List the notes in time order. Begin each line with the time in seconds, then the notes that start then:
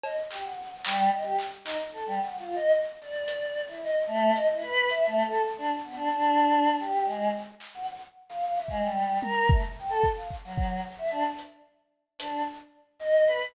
0.03 D#5, cowbell
0.31 G4, clap
0.44 F#5
0.58 F#5
0.85 G3, clap
1.12 D#5
1.24 G4
1.39 clap
1.64 D#4, clap
1.93 A4
2.07 G3
2.20 F#5
2.39 F4
2.55 D#5
3.01 D5
3.28 closed hi-hat
3.68 E4
3.83 D#5
4.07 A3
4.34 D#5, closed hi-hat
4.51 E4
4.62 B4
4.90 E5, closed hi-hat
5.06 A3
5.25 A4
5.58 D4
5.84 B3
5.96 D4
6.11 D4
6.79 G4
7.05 G#3
7.60 clap
7.74 F#5
8.29 F5
8.42 F5
8.55 E5
8.68 G#3, kick
8.82 G3
9.22 A#4, high tom
9.49 A3, kick
9.78 G5
9.89 A4
10.03 kick
10.16 F5
10.31 kick
10.44 F#3
10.58 kick
10.98 E5
11.11 D4
11.39 closed hi-hat
12.18 D4, closed hi-hat
12.99 D#5
13.27 B4